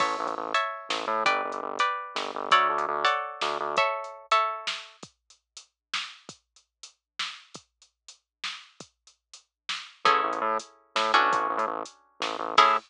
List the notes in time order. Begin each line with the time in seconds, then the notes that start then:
0.00 A1 C#5 E5 A5, kick, crash
0.19 A1
0.27 A1, closed hi-hat
0.37 A1
0.54 C#5 E5 A5, closed hi-hat
0.89 A1, snare
1.07 A2
1.26 G1 B4 D5 G5, kick, closed hi-hat
1.45 G1
1.52 G1, closed hi-hat
1.63 G1
1.79 B4 D5 G5, closed hi-hat
2.15 G1, snare
2.35 G1
2.51 D2 A4 C#5 D5 F#5, kick, closed hi-hat
2.69 D2
2.78 D2, closed hi-hat
2.88 D2
3.05 A4 C#5 D5 F#5, closed hi-hat
3.41 D2, snare
3.60 D2
3.77 A4 C#5 E5, kick, closed hi-hat
4.04 closed hi-hat
4.31 A4 C#5 E5, closed hi-hat
4.67 snare
5.03 kick, closed hi-hat
5.30 closed hi-hat
5.57 closed hi-hat
5.94 snare
6.29 kick, closed hi-hat
6.56 closed hi-hat
6.83 closed hi-hat
7.19 snare
7.54 kick, closed hi-hat
7.82 closed hi-hat
8.08 closed hi-hat
8.44 snare
8.80 kick, closed hi-hat
9.07 closed hi-hat
9.34 closed hi-hat
9.69 snare
10.05 A1 C#4 E4 G#4 A4, kick, closed hi-hat
10.24 A1
10.32 A1, closed hi-hat
10.41 A2
10.60 closed hi-hat
10.95 A2, snare
11.14 A1 C#4 D4 F#4 A4
11.31 A1, kick, closed hi-hat
11.49 A1
11.57 A2, closed hi-hat
11.67 A1
11.85 closed hi-hat
12.20 A1, snare
12.39 A1
12.57 A2 C#4 E4 G#4 A4, kick, crash